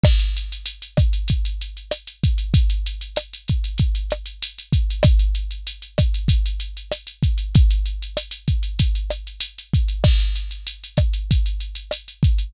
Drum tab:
CC |x---------------|----------------|----------------|----------------|
HH |-xxxxxxxxxxxxxxx|xxxxxxxxxxxxxxxx|xxxxxxxxxxxxxxxx|xxxxxxxxxxxxxxxx|
SD |r-----r-----r---|----r-----r-----|r-----r-----r---|----r-----r-----|
BD |o-----o-o-----o-|o-----o-o-----o-|o-----o-o-----o-|o-----o-o-----o-|

CC |x---------------|
HH |-xxxxxxxxxxxxxxx|
SD |r-----r-----r---|
BD |o-----o-o-----o-|